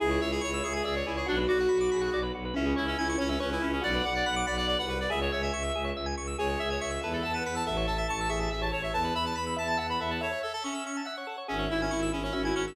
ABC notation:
X:1
M:6/8
L:1/16
Q:3/8=94
K:C#phr
V:1 name="Clarinet"
G2 c G c2 G G G c E G | D z F8 z2 | C2 E C E2 C C C E C C | d2 f d f2 d d d f B d |
e c c e5 z4 | c2 e c e2 B A a B B a | e2 a e a2 e e e a c e | a2 b a b2 a a a b e a |
c2 A A C4 z4 | C2 E C E2 C C C E C C |]
V:2 name="Acoustic Grand Piano"
E6 e2 d4 | F6 G2 z4 | C6 c2 B4 | f6 f2 f4 |
G4 z8 | G6 e2 f4 | A6 G4 z2 | B6 e2 f4 |
e6 e2 f4 | e6 E2 F4 |]
V:3 name="Drawbar Organ"
G c e g c' e' c' g e c G c | F B d f b d' b f d B F B | E G c e g c' g e c G E G | F B d f b d' b f d B F B |
G c e g c' e' G c e g c' e' | G c e g c' e' A B e a b e' | A c e a c' e' c' a e c A c | A B e a b e' b a e B A B |
A c e a c' e' c' a e c A c | G c e g c' e' G c e g c' e' |]
V:4 name="Violin" clef=bass
C,,2 C,,2 C,,2 C,,2 C,,2 C,,2 | B,,,2 B,,,2 B,,,2 B,,,2 B,,,2 B,,,2 | C,,2 C,,2 C,,2 C,,2 C,,2 C,,2 | B,,,2 B,,,2 B,,,2 B,,,3 ^B,,,3 |
C,,2 C,,2 C,,2 C,,2 C,,2 C,,2 | C,,2 C,,2 C,,2 E,,2 E,,2 E,,2 | A,,,2 A,,,2 A,,,2 A,,,2 A,,,2 A,,,2 | E,,2 E,,2 E,,2 E,,2 E,,2 E,,2 |
z12 | G,,,2 G,,,2 G,,,2 G,,,2 G,,,2 G,,,2 |]